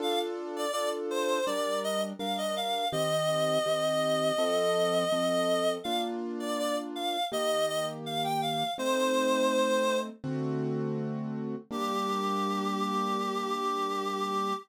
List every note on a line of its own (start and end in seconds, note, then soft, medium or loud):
0.00 0.66 D4 loud
0.00 0.66 F4 loud
0.00 0.66 A4 loud
0.00 0.19 F5 loud
0.56 0.71 D5 loud
0.72 1.39 D4 medium
0.72 1.39 F4 medium
0.72 1.39 A4 medium
0.72 0.89 D5 loud
1.11 1.45 C5 loud
1.46 2.13 G3 loud
1.46 2.13 D4 medium
1.46 2.13 A#4 medium
1.46 1.79 D5 loud
1.84 2.01 D#5 loud
2.19 2.85 G3 medium
2.19 2.85 D4 medium
2.19 2.85 A#4 medium
2.19 2.37 F5 medium
2.37 2.55 D#5 medium
2.56 2.88 F5 loud
2.92 3.58 D#3 medium
2.92 3.58 C4 loud
2.92 3.58 G4 medium
2.92 5.71 D#5 loud
3.66 4.32 D#3 medium
3.66 4.32 C4 medium
3.66 4.32 G4 medium
4.38 5.04 F3 loud
4.38 5.04 C4 loud
4.38 5.04 A4 loud
5.12 5.78 F3 medium
5.12 5.78 C4 medium
5.12 5.78 A4 medium
5.84 7.17 A#3 medium
5.84 7.17 D4 loud
5.84 7.17 F4 loud
5.84 6.01 F5 loud
6.40 6.57 D5 medium
6.58 6.76 D5 loud
6.95 7.25 F5 loud
7.32 8.64 D#3 medium
7.32 8.64 A#3 loud
7.32 8.64 G4 medium
7.32 7.66 D#5 loud
7.68 7.86 D#5 loud
8.06 8.23 F5 loud
8.24 8.41 G5 medium
8.41 8.71 F5 loud
8.78 10.10 A3 medium
8.78 10.10 C4 loud
8.78 10.10 D#4 medium
8.78 9.98 C5 loud
10.24 11.55 D3 loud
10.24 11.55 A3 loud
10.24 11.55 C4 loud
10.24 11.55 F#4 loud
11.71 14.53 G3 loud
11.71 14.53 A#3 loud
11.71 14.53 D4 medium
11.71 14.54 G4 loud